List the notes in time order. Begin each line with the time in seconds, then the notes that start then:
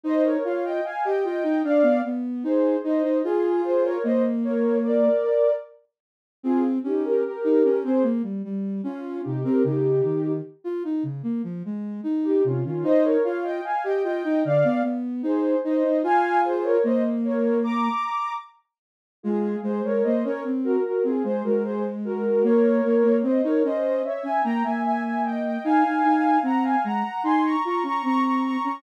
0.04 D#4 C5 D#5
0.24 A#4 C#5
0.45 F4 C#5 F5
0.64 D#5 G5
0.84 F5 G#5
1.04 G4 D#5 G5
1.24 F4 D#5 G5
1.44 D#4
1.64 D4 D5 F5
1.83 B3
2.05 B3
2.44 D#4 G#4 C5
2.84 D#4 C5 D#5
3.03 D#4
3.24 F4 G#4
3.64 G#4 C5
3.84 A#4 C#5
4.04 A#3 C5 D#5
4.44 A#4 C#5
4.83 A#4 D5
6.43 C4 F4 G#4
6.84 C#4 D#4 G4
7.05 G4 A#4
7.24 G4 A#4
7.44 D#4
7.64 C#4
7.84 C4 G#4 C5
8.03 A#3
8.23 G3
8.45 G3
8.84 C#4 F4
9.23 C3 D#4 G4
9.43 C4 G4 A#4
9.64 C#3 D#4 G4
10.04 D#3
10.64 F4
10.85 D#4
11.03 C#3
11.23 A#3
11.44 F3
11.65 G#3
12.04 D#4
12.24 D#4 G4
12.44 C3 C#4 F4
12.65 D#3 C#4 F4
12.83 D#4 C5 D#5
13.04 A#4 C#5
13.24 F4 C#5 F5
13.44 D#5 G5
13.64 F5 G#5
13.84 G4 D#5 G5
14.04 F4 D#5 G5
14.25 D#4
14.45 D3 D5 F5
14.64 B3
14.83 B3
15.23 D#4 G#4 C5
15.64 D#4 C5 D#5
15.84 D#4
16.03 F4 F5 G#5
16.45 G#4 C5
16.64 A#4 C#5
16.84 A#3 C5 D#5
17.24 A#4 C#5
17.64 A#5 D6
19.23 G#3 F4 G#4
19.63 G#3 G#4 C5
19.84 G#3 A#4 C#5
20.04 A#3 C5 D#5
20.24 C#4 A#4 C#5
20.45 C4
20.64 F#4 A#4
20.84 F#4 A#4
21.04 C4 F4 G#4
21.24 G#3 G#4 C5
21.44 G#3 F#4 A#4
21.64 G#4 C5
22.05 F#4 A#4
22.43 A#3 A#4 C#5
22.85 A#3
23.04 A#3
23.23 C4 C5 D#5
23.44 D#4 A#4 C#5
23.64 C#4 C5 D#5
24.04 C#5 E5
24.23 C#4 E5 G#5
24.44 A#3 G5 A#5
24.64 A#3 E5 G#5
24.84 E5 G#5
25.03 E5 G#5
25.24 D#5 G5
25.44 D#5 G5
25.64 D#4 F5 G#5
25.84 D#4
26.04 D#4
26.43 C4 F#5 A#5
26.63 F5 G#5
26.84 G#3 F#5 A#5
27.24 D#4 G#5 C6
27.44 A#5 C#6
27.64 F4 A#5 C#6
27.83 C#4 A#5 C#6
28.03 C4 A#5 C#6
28.24 A#5 C#6
28.44 A#5 C#6
28.64 C#4 A#5 C#6